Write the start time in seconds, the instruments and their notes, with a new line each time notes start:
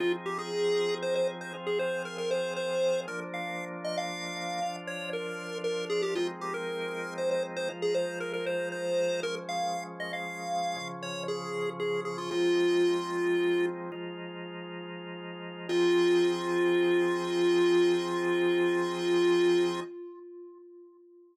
0.00 drawbar organ F3 C4 D#4 G#4, lead 1 (square) F4
0.26 lead 1 (square) G4
0.39 lead 1 (square) G#4
1.02 lead 1 (square) C5
1.15 lead 1 (square) C5
1.41 lead 1 (square) C5
1.54 drawbar organ F3 C4 F4 G#4
1.67 lead 1 (square) G#4
1.79 lead 1 (square) C5
2.05 lead 1 (square) A#4
2.18 lead 1 (square) A#4
2.31 lead 1 (square) C5
2.56 lead 1 (square) C5
3.08 drawbar organ F3 A#3 D4, lead 1 (square) A#4
3.34 lead 1 (square) F5
3.85 lead 1 (square) D#5
3.98 lead 1 (square) F5
4.62 drawbar organ F3 D4 F4
4.87 lead 1 (square) C#5
5.13 lead 1 (square) A#4
5.64 lead 1 (square) A#4
5.90 lead 1 (square) G#4
6.02 lead 1 (square) G4
6.15 drawbar organ F3 G#3 C4 D#4, lead 1 (square) F4
6.41 lead 1 (square) G4
6.54 lead 1 (square) A#4
7.18 lead 1 (square) C5
7.31 lead 1 (square) C5
7.57 lead 1 (square) C5
7.69 drawbar organ F3 G#3 D#4 F4
7.82 lead 1 (square) G#4
7.95 lead 1 (square) C5
8.20 lead 1 (square) A#4
8.33 lead 1 (square) A#4
8.46 lead 1 (square) C5
8.72 lead 1 (square) C5
9.23 drawbar organ F3 G#3 C#4, lead 1 (square) A#4
9.49 lead 1 (square) F5
10.00 lead 1 (square) D#5
10.13 lead 1 (square) F5
10.76 drawbar organ C#3 F3 C#4
11.03 lead 1 (square) C#5
11.28 lead 1 (square) G#4
11.80 lead 1 (square) G#4
12.05 lead 1 (square) G#4
12.18 lead 1 (square) F4
12.31 drawbar organ F3 G#3 C4 D#4, lead 1 (square) F4
13.92 drawbar organ F3 G#3 D#4 F4
15.69 drawbar organ F3 C4 D#4 G#4, lead 1 (square) F4